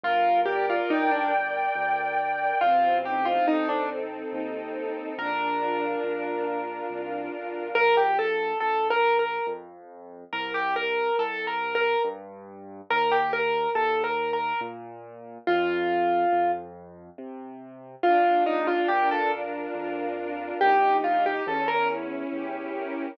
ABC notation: X:1
M:3/4
L:1/16
Q:1/4=70
K:Bb
V:1 name="Acoustic Grand Piano"
F2 G F E D z6 | F2 G F E D z6 | B10 z2 | B G A2 (3A2 B2 B2 z4 |
B G B2 (3A2 B2 B2 z4 | B G B2 (3A2 B2 B2 z4 | F6 z6 | F2 E F G A z6 |
G2 F G A B z6 |]
V:2 name="String Ensemble 1"
B2 d2 g2 B2 d2 g2 | C2 E2 A2 C2 E2 A2 | D2 F2 B2 D2 F2 B2 | z12 |
z12 | z12 | z12 | D2 F2 B2 D2 F2 B2 |
E2 G2 _D2 =E2 G2 B2 |]
V:3 name="Acoustic Grand Piano" clef=bass
G,,,4 G,,,4 D,,4 | A,,,4 A,,,4 E,,4 | B,,,4 B,,,4 C,,2 =B,,,2 | B,,,4 B,,,4 F,,4 |
C,,4 C,,4 G,,4 | E,,4 E,,4 B,,4 | F,,4 F,,4 C,4 | B,,,4 B,,,4 F,,4 |
B,,,4 =E,,4 E,,4 |]